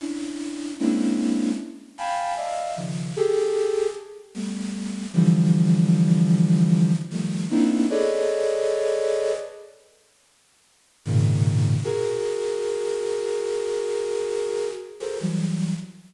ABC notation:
X:1
M:5/4
L:1/16
Q:1/4=76
K:none
V:1 name="Flute"
[_D=DE]4 [_A,_B,C_D=DE]4 z2 [fg_a=a=b]2 [d_e=ef]2 [_D,_E,F,]2 [G_A=A]4 | z2 [G,A,B,]4 [D,E,F,G,]10 [_E,F,G,A,]2 [_B,=B,CD_E=E]2 | [_A=AB_d=d_e]8 z8 [_A,,_B,,=B,,_D,_E,]4 | [_G_A_B]16 [GA=ABc] [E,_G,=G,]3 |]